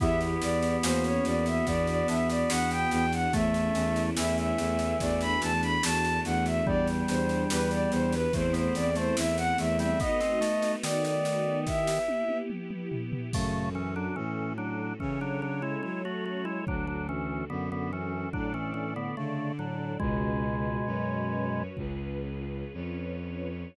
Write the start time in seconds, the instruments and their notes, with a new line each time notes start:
0.00 violin E2 E5, electric piano 2 B3 E4 G4, drawbar organ B3, string ensemble 1 B3 E4 G4, kick, snare
0.21 snare
0.41 violin E2 D5, snare
0.62 snare
0.83 violin E2 C5, electric piano 2 A#3 C#4 F#4, string ensemble 1 A#3 C#4 F#4, snare
1.04 violin C#5, snare
1.25 violin E2 D5, snare
1.46 violin E5, snare
1.66 violin E2 D5, electric piano 2 B3, string ensemble 1 B3 D4 F#4, kick, snare
1.87 violin D5, snare
2.08 violin E2 E5, electric piano 2 D4, snare
2.29 violin D5, snare
2.50 violin E2 F#5, electric piano 2 F#4, snare
2.71 violin G5, snare
2.91 violin E2 G5, electric piano 2 B3, snare
3.12 violin F#5, snare
3.33 violin E2 E5, electric piano 2 A3, drawbar organ A3, string ensemble 1 A3 C#4 E4, kick, snare
3.54 snare
3.74 violin E2, electric piano 2 C#4, snare
3.96 snare
4.16 violin E2 E5, drawbar organ E3, electric piano 2 E4, snare
4.37 violin E5, snare
4.58 violin E2, electric piano 2 A3, snare
4.79 snare
5.00 violin E2 D5, string ensemble 1 A3 D4 F#4, electric piano 2 A3, kick, snare
5.21 violin B5, snare
5.42 violin E2 A5, electric piano 2 D4, snare
5.62 violin B5, snare
5.83 violin E2 A5, electric piano 2 F#4, snare
6.05 snare
6.25 violin E2 F#5, electric piano 2 A3, snare
6.46 violin E5, snare
6.66 violin E2 D5, drawbar organ G3, string ensemble 1 B3 D4 G4, electric piano 2 B3, kick
6.87 snare
7.08 violin E2 C5, electric piano 2 D4, snare
7.29 snare
7.50 violin E2 B4, electric piano 2 G4, snare
7.71 violin D5, snare
7.91 violin E2 C5, electric piano 2 B3, snare
8.12 violin B4, snare
8.33 violin E2 C5, electric piano 2 A3, string ensemble 1 A3 C4 E4, kick, snare
8.53 drawbar organ B3, violin C5, snare
8.74 violin E2 D5, electric piano 2 C4, snare
8.95 drawbar organ A3, violin C5, snare
9.17 violin E2 E5, electric piano 2 E4, snare
9.37 violin F#5, snare
9.58 violin E2 E5, electric piano 2 A3, snare
9.79 drawbar organ G3, violin E5, snare
10.00 string ensemble 1 A3 B3 D#4 F#4, drawbar organ B3, violin D#5, kick, snare
10.20 drawbar organ C4, snare
10.41 drawbar organ A3, snare
10.62 snare
10.83 drawbar organ D#3, violin D5, snare
11.04 violin D5, snare
11.25 snare
11.67 string ensemble 1 B3 E4 G4, violin E5, kick, snare
11.87 snare
12.08 high tom
12.29 high tom
12.50 mid tom
12.70 mid tom
12.92 floor tom
13.12 floor tom
13.33 violin F#2, drawbar organ C#3 A3, string ensemble 1 C#4 F#4 A4, kick, crash
13.75 drawbar organ E3 C#4
13.96 drawbar organ F#3 D4
14.16 violin A2, drawbar organ E3 C#4
14.58 drawbar organ F#3 D4
15.00 violin C#3, drawbar organ E3 C#4, string ensemble 1 C#4 A4 C#5, kick
15.21 drawbar organ F#3 D4
15.42 drawbar organ F#3 D4
15.62 drawbar organ G#3 E4
15.83 violin F#3, drawbar organ G#3 E4
16.05 drawbar organ A3 F#4
16.26 drawbar organ A3 F#4
16.45 drawbar organ G#3 E4
16.67 violin D2, drawbar organ F#3 D4, string ensemble 1 D4 F#4 A4, kick
16.87 drawbar organ F#3 D4
17.09 drawbar organ E3 C#4
17.50 violin F#2, drawbar organ D3 B3
17.72 drawbar organ D3 B3
17.93 drawbar organ E3 C#4
18.33 violin A2, drawbar organ F#3 D4, string ensemble 1 D4 A4 D5, kick
18.54 drawbar organ E3 C#4
18.74 drawbar organ E3 C#4
18.96 drawbar organ D3 B3
19.17 drawbar organ C#3 A3, violin D3
19.59 drawbar organ A2 F#3
19.99 violin C#2, drawbar organ B2 G#3, string ensemble 1 C#4 F#4 G#4 B4, kick
20.85 violin F#2, string ensemble 1 C#4 F#4 B4 C#5
21.77 violin C#2, string ensemble 1 C#4 F4 G#4 B4, kick
22.74 violin F2, string ensemble 1 C#4 F4 B4 C#5